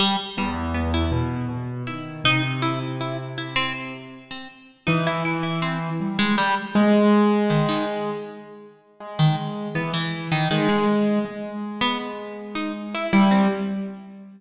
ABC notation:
X:1
M:6/8
L:1/16
Q:3/8=53
K:none
V:1 name="Harpsichord"
G, z G, z B, E z4 E2 | _E z =E z E z E C z3 C | z2 _E =E E E C z2 _A, G, z | z4 _E, E, z6 |
z _E, z2 B, =E,2 _E, E, _A, z2 | z3 B, z3 _E z =E E C |]
V:2 name="Acoustic Grand Piano" clef=bass
z2 E,,4 B,,2 B,,2 _E,2 | C,10 z2 | z2 E,6 G,2 z2 | _A,8 z4 |
_A,4 E,4 A,4 | _A,10 G,2 |]